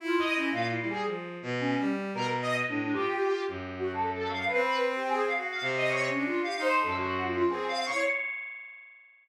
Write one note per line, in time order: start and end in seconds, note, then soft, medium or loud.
0.00 0.49 E4 loud
0.00 0.16 F4 medium
0.19 0.35 D#5 loud
0.36 0.52 C#4 medium
0.51 0.76 A#2 medium
0.51 0.68 F5 medium
0.70 0.86 E4 medium
0.80 1.04 G3 medium
0.89 1.05 G#4 medium
1.05 1.37 F3 soft
1.42 1.74 B2 loud
1.60 1.84 C#4 loud
1.79 2.11 G3 medium
2.13 2.62 B2 medium
2.13 2.27 A#4 loud
2.42 2.54 D#5 loud
2.67 2.92 A2 medium
2.67 2.93 D4 medium
2.93 3.42 F4 medium
2.93 3.41 G4 loud
3.48 4.44 F#2 medium
3.75 3.92 F#4 medium
3.92 4.08 A4 soft
4.11 4.28 A4 medium
4.29 4.45 F5 medium
4.46 4.62 B4 medium
4.53 5.25 C4 loud
4.65 4.81 B4 medium
4.96 5.08 G4 medium
5.09 5.21 G#4 loud
5.23 5.35 F5 medium
5.36 5.60 F#4 medium
5.50 5.62 F5 medium
5.61 6.09 C3 loud
5.77 5.89 D#5 medium
5.89 6.05 C#5 medium
6.08 6.25 C#4 medium
6.15 6.39 D4 medium
6.26 6.42 F4 medium
6.42 6.54 G4 medium
6.42 6.59 F5 medium
6.57 6.82 D#4 loud
6.57 6.76 C5 loud
6.80 7.43 F#2 medium
6.80 6.96 A4 medium
6.97 7.21 F#4 loud
7.24 7.48 F4 medium
7.49 7.85 C4 medium
7.49 7.65 G#4 medium
7.68 7.84 F5 loud
7.86 8.02 C#5 loud
7.91 8.03 E4 medium